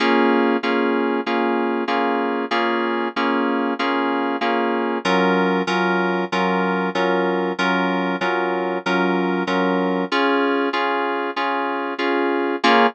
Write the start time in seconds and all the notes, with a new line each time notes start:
0.00 A#3 C#4 F4 G#4
0.63 A#3 C#4 F4 G#4
1.26 A#3 C#4 F4 G#4
1.88 A#3 C#4 F4 G#4
2.51 A#3 C#4 F4 G#4
3.16 A#3 C#4 F4 G#4
3.79 A#3 C#4 F4 G#4
4.41 A#3 C#4 F4 G#4
5.05 F#3 C#4 F4 A#4
5.67 F#3 C#4 F4 A#4
6.32 F#3 C#4 F4 A#4
6.95 F#3 C#4 F4 A#4
7.59 F#3 C#4 F4 A#4
8.21 F#3 C#4 F4 A#4
8.86 F#3 C#4 F4 A#4
9.47 F#3 C#4 F4 A#4
10.12 C#4 F4 G#4
10.73 C#4 F4 G#4
11.36 C#4 F4 G#4
11.99 C#4 F4 G#4
12.64 A#3 C#4 F4 G#4